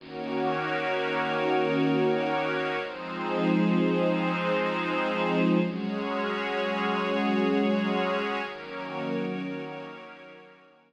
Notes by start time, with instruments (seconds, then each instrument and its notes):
0.00 pad 2 (warm) D#3 A#3 C#4 F#4, pad 5 (bowed) D#4 F#4 A#4 C#5
2.81 pad 2 (warm) F3 G#3 C4 D#4, pad 5 (bowed) F3 D#4 G#4 C5
5.62 pad 2 (warm) F#3 G#3 C#4, pad 5 (bowed) F#4 G#4 C#5
8.43 pad 2 (warm) D#3 F#3 A#3 C#4, pad 5 (bowed) D#4 F#4 A#4 C#5